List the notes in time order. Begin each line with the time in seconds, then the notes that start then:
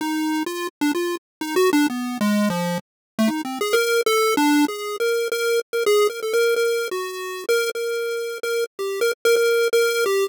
0.01 D#4
0.46 F4
0.81 D4
0.95 F4
1.41 D#4
1.56 F#4
1.73 D4
1.90 B3
2.21 G#3
2.50 F3
3.19 A3
3.28 D#4
3.45 C4
3.61 G#4
3.73 A#4
4.06 A4
4.37 D4
4.68 G#4
5.00 A#4
5.32 A#4
5.73 A#4
5.86 G#4
6.10 A#4
6.23 A4
6.33 A#4
6.56 A#4
6.91 F#4
7.49 A#4
7.75 A#4
8.43 A#4
8.79 G4
9.01 A#4
9.25 A#4
9.36 A#4
9.73 A#4
10.06 G4